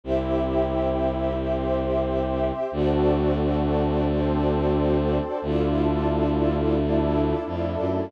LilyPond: <<
  \new Staff \with { instrumentName = "Pad 5 (bowed)" } { \time 4/4 \key g \dorian \tempo 4 = 89 <c' e' g'>2 <c' g' c''>2 | <c' d' fis' a'>2 <c' d' a' c''>2 | <d' e' f' a'>2 <a d' e' a'>2 | }
  \new Staff \with { instrumentName = "String Ensemble 1" } { \time 4/4 \key g \dorian <g' c'' e''>1 | <fis' a' c'' d''>1 | <e' f' a' d''>1 | }
  \new Staff \with { instrumentName = "Violin" } { \clef bass \time 4/4 \key g \dorian c,1 | d,1 | d,2. f,8 fis,8 | }
>>